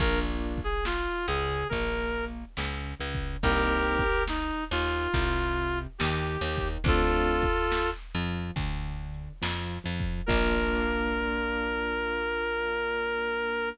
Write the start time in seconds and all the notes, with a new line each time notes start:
0.00 A#1 A#3 D4 F4 A#4, kick, crash
0.58 kick, closed hi-hat
0.64 G#4
0.85 F4, snare
1.28 C#2 C#3 G#4
1.43 closed hi-hat
1.69 A#1 A#3 A#4, kick, closed hi-hat
2.28 closed hi-hat
2.57 C#2 C#3, snare
3.00 C#2 C#3
3.14 kick, closed hi-hat
3.43 C2 A#3 C4 D#4 G4 A#4, kick, closed hi-hat
3.99 kick, closed hi-hat
4.28 D#4, snare
4.71 D#2 D#3 F4
4.85 closed hi-hat
5.14 C2 C3, kick, closed hi-hat
5.70 closed hi-hat
5.98 D#2 D#3 G4, snare
6.41 D#2 D#3
6.57 kick, open hi-hat
6.84 D2 A3 C4 D4 F4 A4, kick, closed hi-hat
7.43 kick, closed hi-hat
7.72 snare
8.15 F2 F3
8.29 closed hi-hat
8.56 D2 D3, kick, closed hi-hat
9.14 closed hi-hat
9.42 F2 F3, snare
9.84 F2 F3
10.00 kick, closed hi-hat
10.26 A#1 A#3 D4 F4 A#4, kick, crash